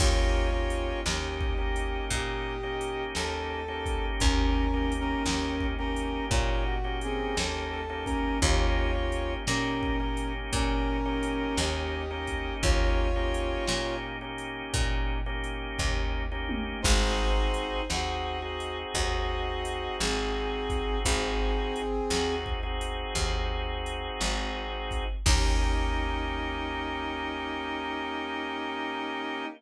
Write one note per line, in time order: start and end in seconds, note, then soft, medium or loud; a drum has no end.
0.00 0.95 D#2 loud
0.00 0.48 A#3 loud
0.00 0.48 C#4 loud
0.00 0.48 D#4 loud
0.00 1.00 F4 medium
0.00 0.48 G4 loud
0.00 1.00 C#5 medium
0.00 kick loud
0.00 crash medium
0.53 1.01 A#3 medium
0.53 1.01 C#4 medium
0.53 1.01 D#4 medium
0.53 1.01 G4 medium
0.70 closed hi-hat medium
1.05 2.00 D#2 medium
1.05 1.54 A#3 medium
1.05 1.54 C#4 medium
1.05 1.54 D#4 medium
1.05 1.54 G4 medium
1.05 2.05 G4 medium
1.05 2.05 D#5 medium
1.05 snare loud
1.41 kick medium
1.58 2.55 A#3 medium
1.58 2.55 C#4 medium
1.58 2.55 D#4 medium
1.58 2.55 G4 medium
1.76 closed hi-hat medium
2.11 3.05 A#2 medium
2.11 3.04 G4 medium
2.11 3.04 D#5 medium
2.11 kick medium
2.11 closed hi-hat medium
2.63 3.60 A#3 medium
2.63 3.60 C#4 medium
2.63 3.60 D#4 medium
2.63 3.60 G4 medium
2.81 closed hi-hat medium
3.15 4.11 D#2 medium
3.15 4.06 A4 medium
3.15 snare medium
3.68 4.65 A#3 medium
3.68 4.65 C#4 medium
3.68 4.65 D#4 medium
3.68 4.65 G4 medium
3.86 kick medium
3.86 closed hi-hat medium
4.19 5.16 D#2 loud
4.19 4.93 C#4 medium
4.19 4.93 A#4 medium
4.19 kick loud
4.19 closed hi-hat loud
4.74 5.22 A#3 medium
4.74 5.22 C#4 medium
4.74 5.22 D#4 medium
4.74 5.22 G4 medium
4.92 closed hi-hat medium
5.00 5.67 C#4 medium
5.00 5.67 A#4 medium
5.26 6.20 D#2 medium
5.26 5.75 A#3 medium
5.26 5.75 C#4 medium
5.26 5.75 D#4 medium
5.26 5.75 G4 medium
5.26 snare loud
5.61 kick medium
5.79 6.76 A#3 medium
5.79 6.25 C#4 medium
5.79 6.76 C#4 medium
5.79 6.76 D#4 medium
5.79 6.76 G4 medium
5.79 6.25 A#4 medium
5.96 closed hi-hat medium
6.31 7.26 A#2 medium
6.31 6.64 F4 medium
6.31 6.64 C#5 medium
6.31 kick medium
6.31 closed hi-hat medium
6.65 6.98 F#4 medium
6.84 7.81 A#3 medium
6.84 7.81 C#4 medium
6.84 7.81 D#4 medium
6.84 7.81 G4 medium
7.01 7.37 C4 medium
7.01 7.37 G#4 medium
7.01 closed hi-hat medium
7.37 8.32 D#2 medium
7.37 7.71 A4 medium
7.37 snare loud
7.71 8.04 A4 medium
7.89 8.38 A#3 loud
7.89 8.38 C#4 medium
7.89 8.38 D#4 medium
7.89 8.38 G4 medium
8.05 8.39 C#4 medium
8.05 8.39 A#4 medium
8.05 kick medium
8.05 closed hi-hat medium
8.42 9.37 D#2 loud
8.42 8.90 A#3 loud
8.42 8.90 C#4 loud
8.42 8.90 D#4 loud
8.42 9.34 F4 medium
8.42 8.90 G4 loud
8.42 9.34 C#5 medium
8.42 kick medium
8.42 closed hi-hat medium
8.95 9.43 A#3 medium
8.95 9.43 C#4 medium
8.95 9.43 D#4 medium
8.95 9.43 G4 medium
9.12 closed hi-hat medium
9.47 10.42 A#2 medium
9.47 9.96 A#3 medium
9.47 9.96 C#4 medium
9.47 10.33 C#4 medium
9.47 9.96 D#4 medium
9.47 9.96 G4 loud
9.47 10.33 A#4 medium
9.47 snare medium
9.83 kick medium
10.00 10.97 A#3 medium
10.00 10.97 C#4 medium
10.00 10.97 D#4 medium
10.00 10.97 G4 medium
10.17 closed hi-hat medium
10.53 11.47 A#2 medium
10.53 11.57 C#4 medium
10.53 11.57 A#4 medium
10.53 kick medium
10.53 closed hi-hat medium
11.05 12.02 A#3 medium
11.05 12.02 C#4 loud
11.05 12.02 D#4 loud
11.05 12.02 G4 medium
11.23 closed hi-hat medium
11.57 12.52 D#2 medium
11.57 12.55 G4 medium
11.57 12.55 D#5 medium
11.57 snare medium
12.11 13.07 A#3 medium
12.11 13.07 C#4 loud
12.11 13.07 D#4 loud
12.11 13.07 G4 medium
12.27 kick medium
12.27 closed hi-hat medium
12.62 13.57 D#2 medium
12.62 13.96 F4 medium
12.62 13.96 C#5 medium
12.62 kick loud
12.62 closed hi-hat medium
13.16 13.64 A#3 medium
13.16 13.64 C#4 medium
13.16 13.64 D#4 medium
13.16 13.64 G4 medium
13.34 closed hi-hat medium
13.68 14.63 A#2 medium
13.68 14.17 A#3 medium
13.68 14.17 C#4 medium
13.68 14.17 D#4 medium
13.68 14.17 G4 medium
13.68 snare loud
14.21 15.18 A#3 medium
14.21 15.18 C#4 medium
14.21 15.18 D#4 medium
14.21 15.18 G4 medium
14.38 closed hi-hat medium
14.74 15.68 A#2 medium
14.74 kick medium
14.74 closed hi-hat loud
15.26 16.23 A#3 medium
15.26 16.23 C#4 medium
15.26 16.23 D#4 medium
15.26 16.23 G4 medium
15.44 closed hi-hat medium
15.79 16.74 D#2 medium
15.79 kick medium
15.79 floor tom medium
16.32 16.80 A#3 medium
16.32 16.80 C#4 medium
16.32 16.80 D#4 medium
16.32 16.80 G4 medium
16.49 high tom loud
16.82 17.80 G#1 loud
16.82 17.81 C4 loud
16.82 17.82 D#4 medium
16.82 17.81 D#4 loud
16.82 17.81 F#4 loud
16.82 17.81 G#4 loud
16.82 17.82 C5 medium
16.82 kick loud
16.82 crash loud
17.54 closed hi-hat medium
17.89 18.85 D#2 medium
17.89 18.38 C4 medium
17.89 18.38 D#4 medium
17.89 18.38 F#4 medium
17.89 18.78 F#4 medium
17.89 18.38 G#4 medium
17.89 18.78 D#5 medium
17.89 snare medium
18.42 21.81 C4 medium
18.42 21.81 D#4 medium
18.42 21.81 F#4 medium
18.42 21.81 G#4 medium
18.60 closed hi-hat medium
18.94 19.89 D#2 medium
18.94 19.96 F#4 medium
18.94 19.96 D#5 medium
18.94 kick medium
18.94 closed hi-hat medium
19.65 closed hi-hat medium
20.00 20.95 G#1 medium
20.00 20.99 C4 medium
20.00 20.99 G#4 medium
20.00 snare loud
20.70 kick medium
20.70 closed hi-hat medium
21.05 22.00 G#1 loud
21.05 22.35 C4 medium
21.05 22.35 G#4 medium
21.05 kick medium
21.05 closed hi-hat loud
21.76 closed hi-hat medium
22.10 23.05 D#2 medium
22.10 22.59 C4 medium
22.10 22.59 D#4 medium
22.10 22.59 F#4 medium
22.10 22.59 G#4 medium
22.10 snare loud
22.46 kick medium
22.63 25.05 C4 medium
22.63 25.05 D#4 medium
22.63 25.05 F#4 medium
22.63 25.05 G#4 medium
22.81 closed hi-hat medium
23.15 24.10 D#2 medium
23.15 kick medium
23.15 closed hi-hat medium
23.86 closed hi-hat medium
24.21 25.16 G#1 medium
24.21 snare medium
24.91 kick medium
24.91 closed hi-hat medium
25.26 29.45 D#2 loud
25.26 29.45 A#3 loud
25.26 29.45 C#4 loud
25.26 29.45 D#4 loud
25.26 29.45 G4 loud
25.26 kick loud
25.26 crash loud